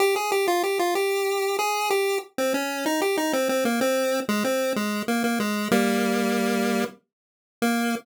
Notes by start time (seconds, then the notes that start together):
0.00 G4
0.16 G#4
0.32 G4
0.48 F4
0.63 G4
0.79 F4
0.95 G4
1.59 G#4
1.90 G4
2.38 C4
2.54 C#4
2.86 D#4
3.02 G4
3.17 D#4
3.33 C4
3.49 C4
3.65 A#3
3.81 C4
4.29 G#3
4.44 C4
4.76 G#3
5.08 A#3
5.24 A#3
5.40 G#3
5.71 G3 A#3
7.62 A#3